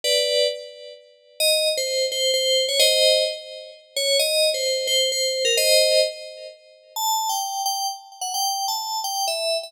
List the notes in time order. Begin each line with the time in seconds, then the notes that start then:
0.04 B4 D5
1.40 D#5
1.77 C5
2.12 C5
2.34 C5
2.68 C#5
2.80 C5 D#5
3.96 C#5
4.19 D#5
4.54 C5
4.87 C5
5.12 C5
5.45 A#4
5.57 C5 D#5
6.96 A5
7.29 G5
7.66 G5
8.21 F#5
8.34 G5
8.68 A5
9.04 G5
9.27 E5
9.63 E5